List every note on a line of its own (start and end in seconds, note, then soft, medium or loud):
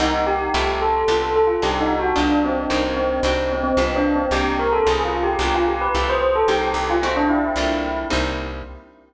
0.00 0.50 C2 medium
0.00 0.52 A#3 medium
0.00 0.52 C4 medium
0.00 0.24 D#4 loud
0.00 0.52 D#4 medium
0.00 0.52 G4 medium
0.27 0.78 G4 medium
0.54 1.04 C2 medium
0.54 1.07 A3 medium
0.54 1.07 E4 medium
0.54 1.07 F4 medium
0.54 1.07 G4 medium
0.82 1.34 A4 medium
1.08 1.58 C2 medium
1.08 1.61 B3 medium
1.08 1.61 D4 medium
1.08 1.61 F4 medium
1.08 1.61 G4 medium
1.36 1.48 A4 medium
1.47 1.60 F4 medium
1.62 2.13 C2 medium
1.62 2.15 C4 medium
1.62 2.15 D4 medium
1.62 2.15 D#4 medium
1.62 2.15 F#4 medium
1.62 1.80 G4 medium
1.80 1.98 D#4 loud
1.99 2.16 F#4 medium
2.16 2.67 C2 medium
2.16 2.69 B3 medium
2.16 2.69 D4 medium
2.16 2.38 D4 loud
2.16 2.69 F4 medium
2.16 2.69 G4 medium
2.44 2.92 C4 medium
2.70 3.20 C2 medium
2.70 3.23 A#3 medium
2.70 3.23 C4 medium
2.70 3.23 D#4 medium
2.70 3.23 G4 medium
2.97 3.49 C4 medium
3.23 3.73 C2 medium
3.23 3.77 C4 medium
3.23 3.77 D4 medium
3.23 3.77 D#4 medium
3.23 3.77 F#4 medium
3.53 3.63 C4 medium
3.64 3.76 C4 medium
3.77 4.27 C2 medium
3.77 4.31 B3 medium
3.77 3.95 C4 medium
3.77 4.31 D4 medium
3.77 4.31 F4 medium
3.77 4.31 G4 medium
3.96 4.13 D4 medium
4.16 4.33 C4 medium
4.31 4.81 C2 medium
4.31 4.86 A#3 medium
4.31 4.86 C4 medium
4.31 4.86 D#4 medium
4.31 4.54 G4 loud
4.31 4.86 G4 medium
4.59 4.72 A#4 medium
4.73 4.85 A4 medium
4.86 5.36 C2 loud
4.86 5.40 C4 medium
4.86 5.40 C#4 medium
4.86 5.40 D#4 medium
4.86 5.40 F4 medium
4.86 5.04 G#4 medium
5.05 5.22 F4 medium
5.23 5.40 G4 medium
5.39 5.89 C2 loud
5.39 5.94 B3 medium
5.39 5.94 D4 medium
5.39 5.94 F4 medium
5.39 5.94 G4 medium
5.39 5.55 G4 medium
5.54 5.67 F4 medium
5.68 5.81 G4 medium
5.81 6.06 B4 medium
5.95 6.44 C2 medium
5.95 6.48 A3 medium
5.95 6.48 E4 medium
5.95 6.48 F4 medium
5.95 6.48 G4 medium
6.09 6.35 C5 medium
6.36 6.48 A4 medium
6.48 6.73 C2 medium
6.48 7.01 A#3 medium
6.48 7.01 C4 medium
6.48 7.01 D#4 medium
6.48 6.61 G4 loud
6.48 7.01 G4 medium
6.63 6.87 G4 medium
6.74 7.51 C2 medium
6.90 7.02 F4 medium
7.02 7.56 A3 medium
7.02 7.15 C4 medium
7.02 7.56 C4 medium
7.02 7.56 E4 medium
7.02 7.56 F#4 medium
7.17 7.30 D4 loud
7.29 8.03 E4 medium
7.56 8.05 C2 medium
7.56 8.10 A3 medium
7.56 8.10 A#3 medium
7.56 8.10 D4 medium
7.56 8.10 F4 medium
8.10 8.63 C2 medium
8.10 8.63 G3 medium
8.10 8.63 A#3 medium
8.10 8.63 C4 medium
8.10 8.63 D#4 medium